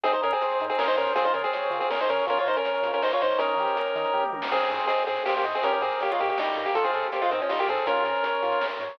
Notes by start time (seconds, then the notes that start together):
0.04 G#1 C4 D#4 G#4, kick, closed hi-hat
0.13 D#4 C5, closed hi-hat
0.22 G#2 C#4 G#4 A#4, closed hi-hat
0.32 C4 G#4, closed hi-hat
0.40 G#1 C5, closed hi-hat
0.51 closed hi-hat
0.60 G#2 D#4, closed hi-hat
0.70 C4 G#4, closed hi-hat
0.78 G#1 C#4 G#4 A#4, snare
0.88 D#4 C5, closed hi-hat
0.97 G#2 C#4 A#4 C5, closed hi-hat
1.07 closed hi-hat
1.15 C#2 C4 F4 G#4, kick, closed hi-hat
1.25 D#4 C5, closed hi-hat
1.34 C#3 C#4 G#4 A#4, closed hi-hat
1.44 C4 G#4, closed hi-hat
1.53 C#2 C#5, closed hi-hat
1.63 closed hi-hat
1.70 C#3 F4, closed hi-hat
1.80 C4 G#4, closed hi-hat
1.90 C#2 C#4 G#4 A#4, snare
2.00 D#4 C5, closed hi-hat
2.08 C#3 C#4 A#4 C#5, closed hi-hat
2.18 closed hi-hat
2.27 A#1 C#4 F4 A#4, kick, closed hi-hat
2.37 F4 C#5, closed hi-hat
2.45 A#2 D#4 A#4 C5, closed hi-hat
2.56 C#4 A#4, closed hi-hat
2.65 A#1 C#5, closed hi-hat
2.74 closed hi-hat
2.82 A#2 F4, closed hi-hat
2.93 C#4 A#4, closed hi-hat
3.00 A#1 D#4 A#4 C5, snare
3.12 F4 C#5, closed hi-hat
3.21 A#2 D#4 C5 C#5, closed hi-hat
3.30 closed hi-hat
3.39 D#2 C#4 D#4 A#4, kick, closed hi-hat
3.49 closed hi-hat
3.56 D#3 G4, closed hi-hat
3.68 closed hi-hat
3.77 D#2 A#4, closed hi-hat
3.86 closed hi-hat
3.95 D#3 D#4, closed hi-hat
4.05 closed hi-hat
4.14 D#2 G4, kick, floor tom
4.23 mid tom
4.32 D#3 A#4, high tom
4.42 snare
4.51 G#1 C4 G#4, kick, crash
4.61 closed hi-hat
4.70 G#2 C5, closed hi-hat
4.80 closed hi-hat
4.87 G#1 C4 G#4 D#5, closed hi-hat
4.98 closed hi-hat
5.07 G#2 C4 G#4, closed hi-hat
5.17 closed hi-hat
5.25 G#1 A#3 G4 C5, snare
5.35 A#3 G4, closed hi-hat
5.44 G#2 D#5, closed hi-hat
5.54 C4 G#4, closed hi-hat
5.62 G#1 C#4 G4 A#4, kick, closed hi-hat
5.72 C#4 A#4, closed hi-hat
5.80 G#2 C4 G#4 A#4, closed hi-hat
5.91 closed hi-hat
6.00 G#1 A#3 G4 C#5, closed hi-hat
6.10 G#3 F4, closed hi-hat
6.19 G#2 A#3 G4 D#5, closed hi-hat
6.28 A#3 G4, closed hi-hat
6.37 G#1 G3 D#4 G4, snare
6.47 closed hi-hat
6.56 G#2 A#4, closed hi-hat
6.66 A#3 G4, closed hi-hat
6.74 G#1 F4 A4, kick, closed hi-hat
6.84 C4 G#4, closed hi-hat
6.94 G#2 A4, closed hi-hat
7.03 closed hi-hat
7.12 G#1 A#3 G4 C5, closed hi-hat
7.22 G#3 F4, closed hi-hat
7.29 G#2 D#3 C4 D#5, closed hi-hat
7.40 F3 C#4, closed hi-hat
7.49 G#1 G3 D#4 F4, snare
7.59 A#3 G4, closed hi-hat
7.68 G#2 C4 G#4 A4, closed hi-hat
7.77 closed hi-hat
7.86 G#1 C#4 F4 A#4, kick, closed hi-hat
7.96 closed hi-hat
8.04 G#2 A#4, closed hi-hat
8.15 closed hi-hat
8.24 G#1 C#5, closed hi-hat
8.34 closed hi-hat
8.43 G#2 F4, closed hi-hat
8.52 closed hi-hat
8.61 G#1 A#4, snare
8.71 closed hi-hat
8.79 G#2 C#5, closed hi-hat
8.89 closed hi-hat